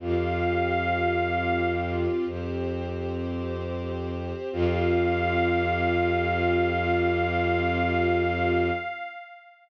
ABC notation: X:1
M:4/4
L:1/8
Q:1/4=53
K:Fmix
V:1 name="Pad 5 (bowed)"
f3 z5 | f8 |]
V:2 name="Violin" clef=bass
F,,4 F,,4 | F,,8 |]
V:3 name="String Ensemble 1"
[CFG]4 [CGc]4 | [CFG]8 |]